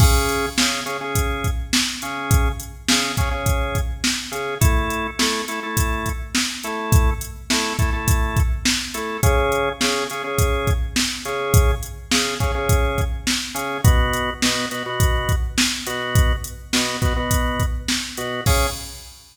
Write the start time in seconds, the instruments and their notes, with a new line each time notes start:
0.00 drawbar organ C#3 C#4 G#4, kick, crash
0.29 closed hi-hat
0.58 drawbar organ C#3 C#4 G#4, snare
0.86 drawbar organ C#3 C#4 G#4, closed hi-hat
1.01 drawbar organ C#3 C#4 G#4
1.15 kick, closed hi-hat
1.44 kick, closed hi-hat
1.73 snare
2.02 drawbar organ C#3 C#4 G#4, closed hi-hat
2.31 kick, closed hi-hat
2.60 closed hi-hat
2.88 drawbar organ C#3 C#4 G#4, snare
3.17 drawbar organ C#3 C#4 G#4, kick, closed hi-hat
3.31 drawbar organ C#3 C#4 G#4
3.46 kick, closed hi-hat
3.75 kick, closed hi-hat
4.04 snare
4.32 drawbar organ C#3 C#4 G#4, closed hi-hat
4.61 drawbar organ A3 E4 A4, kick, closed hi-hat
4.90 closed hi-hat
5.19 drawbar organ A3 E4 A4, snare
5.48 drawbar organ A3 E4 A4, closed hi-hat
5.63 drawbar organ A3 E4 A4
5.77 kick, closed hi-hat
6.06 kick, closed hi-hat
6.35 snare
6.63 drawbar organ A3 E4 A4, closed hi-hat
6.92 kick, closed hi-hat
7.21 closed hi-hat
7.50 drawbar organ A3 E4 A4, snare
7.79 drawbar organ A3 E4 A4, kick, closed hi-hat
7.93 drawbar organ A3 E4 A4
8.08 kick, closed hi-hat
8.37 kick, closed hi-hat
8.65 snare
8.94 drawbar organ A3 E4 A4, closed hi-hat
9.23 drawbar organ C#3 C#4 G#4, kick, closed hi-hat
9.52 closed hi-hat
9.81 drawbar organ C#3 C#4 G#4, snare
10.10 drawbar organ C#3 C#4 G#4, closed hi-hat
10.24 drawbar organ C#3 C#4 G#4
10.38 kick, closed hi-hat
10.67 kick, closed hi-hat
10.96 snare
11.25 drawbar organ C#3 C#4 G#4, closed hi-hat
11.54 kick, closed hi-hat
11.83 closed hi-hat
12.11 drawbar organ C#3 C#4 G#4, snare
12.40 drawbar organ C#3 C#4 G#4, kick, closed hi-hat
12.55 drawbar organ C#3 C#4 G#4
12.69 kick, closed hi-hat
12.98 kick, closed hi-hat
13.27 snare
13.55 drawbar organ C#3 C#4 G#4, closed hi-hat
13.84 drawbar organ B2 B3 F#4, kick, closed hi-hat
14.13 closed hi-hat
14.42 drawbar organ B2 B3 F#4, snare
14.71 drawbar organ B2 B3 F#4, closed hi-hat
14.86 drawbar organ B2 B3 F#4
15.00 kick, closed hi-hat
15.29 kick, closed hi-hat
15.58 snare
15.87 drawbar organ B2 B3 F#4, closed hi-hat
16.15 kick, closed hi-hat
16.44 closed hi-hat
16.73 drawbar organ B2 B3 F#4, snare
17.02 drawbar organ B2 B3 F#4, kick, closed hi-hat
17.16 drawbar organ B2 B3 F#4
17.31 kick, closed hi-hat
17.60 kick, closed hi-hat
17.88 snare
18.17 drawbar organ B2 B3 F#4, closed hi-hat
18.46 drawbar organ C#3 C#4 G#4, kick, crash